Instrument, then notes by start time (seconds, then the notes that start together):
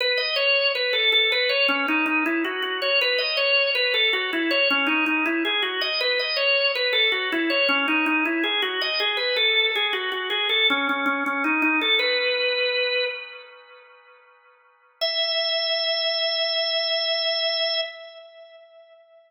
drawbar organ
0.00 B4
0.18 D#5
0.36 C#5
0.75 B4
0.93 A4
1.12 A4
1.32 B4
1.49 C#5
1.68 C#4
1.88 D#4
2.06 D#4
2.26 E4
2.45 F#4
2.62 F#4
2.82 C#5
3.01 B4
3.18 D#5
3.37 C#5
3.75 B4
3.94 A4
4.13 F#4
4.33 E4
4.51 C#5
4.70 C#4
4.87 D#4
5.06 D#4
5.26 E4
5.45 G#4
5.62 F#4
5.81 D#5
6.01 B4
6.19 D#5
6.36 C#5
6.75 B4
6.93 A4
7.12 F#4
7.32 E4
7.50 C#5
7.69 C#4
7.88 D#4
8.06 D#4
8.25 E4
8.44 G#4
8.62 F#4
8.81 D#5
9.00 G#4
9.17 B4
9.36 A4
9.75 G#4
9.93 F#4
10.12 F#4
10.30 G#4
10.49 A4
10.70 C#4
10.89 C#4
11.06 C#4
11.26 C#4
11.44 D#4
11.62 D#4
11.81 A4
11.99 B4
15.01 E5